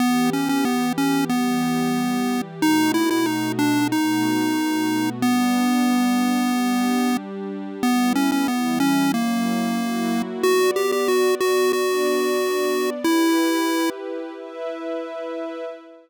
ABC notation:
X:1
M:4/4
L:1/16
Q:1/4=92
K:Edor
V:1 name="Lead 1 (square)"
B,2 C C B,2 C2 B,8 | ^D2 E E D2 =D2 ^D8 | B,14 z2 | B,2 C C B,2 C2 ^A,8 |
F2 G G F2 F2 F8 | E6 z10 |]
V:2 name="Pad 2 (warm)"
[E,B,G]8 [E,G,G]8 | [B,,A,^DF]8 [B,,A,B,F]8 | [G,B,D]8 [G,DG]8 | [G,B,E]4 [E,G,E]4 [F,^A,CE]4 [F,A,EF]4 |
[B,Fd]8 [B,Dd]8 | [EGB]8 [EBe]8 |]